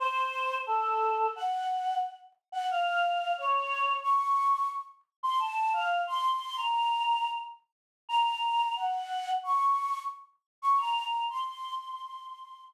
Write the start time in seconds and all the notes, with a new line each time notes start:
0.00 C5
0.67 A4
1.36 F#5
2.52 F#5
2.71 F5
3.38 C#5
4.03 C#6
5.23 C6
5.39 A5
5.73 F5
6.07 C6
6.56 A#5
8.09 A#5
8.76 F#5
9.43 C#6
10.62 C#6
10.78 A#5
11.29 C6